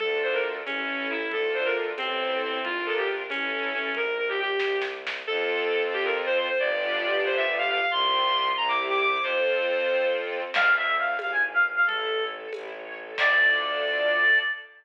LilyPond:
<<
  \new Staff \with { instrumentName = "Violin" } { \time 6/8 \key d \minor \tempo 4. = 91 a'8 c''16 bes'16 r8 cis'4 e'8 | a'8 c''16 bes'16 r8 c'4 c'8 | f'8 a'16 g'16 r8 cis'4 cis'8 | bes'8 bes'16 g'16 g'4 r4 |
\key f \major a'4. g'16 bes'16 r16 c''16 c''16 c''16 | d''4. c''16 e''16 r16 f''16 f''16 f''16 | c'''4. bes''16 d'''16 r16 d'''16 d'''16 d'''16 | c''2 r4 |
\key d \minor r2. | r2. | r2. | }
  \new Staff \with { instrumentName = "Clarinet" } { \time 6/8 \key d \minor r2. | r2. | r2. | r2. |
\key f \major r2. | r2. | r2. | r2. |
\key d \minor f''8 e''8 f''8 f''16 gis''16 r16 f''16 r16 f''16 | a'4 r2 | d''2. | }
  \new Staff \with { instrumentName = "String Ensemble 1" } { \time 6/8 \key d \minor <d' f' a'>4. <cis' e' a'>4. | <d' f' a'>4. <c' e' a'>4. | <d' f' bes'>4. <cis' e' a'>4. | r2. |
\key f \major <c' f' a'>2. | <b d' f' g'>2. | <c' f' g'>4. <c' e' g'>4. | <c' f' a'>2. |
\key d \minor d'8 a'8 f'8 e'8 b'8 gis'8 | e'8 cis''8 a'8 e'8 cis''8 a'8 | <d' f' a'>2. | }
  \new Staff \with { instrumentName = "Violin" } { \clef bass \time 6/8 \key d \minor d,4. a,,4. | d,4. a,,4. | bes,,4. a,,4. | bes,,4. c,4. |
\key f \major f,2. | g,,2. | c,4. c,4. | f,2. |
\key d \minor d,4. gis,,4. | a,,4. a,,4. | d,2. | }
  \new DrumStaff \with { instrumentName = "Drums" } \drummode { \time 6/8 cgl4. <cgho tamb>4. | cgl4. <cgho tamb>4. | cgl4. <cgho tamb>4. | cgl4. <bd sn>8 sn8 sn8 |
r4. r4. | r4. r4. | r4. r4. | r4. r4. |
<cgl cymc>4. <cgho tamb>4. | cgl4. <cgho tamb>4. | <cymc bd>4. r4. | }
>>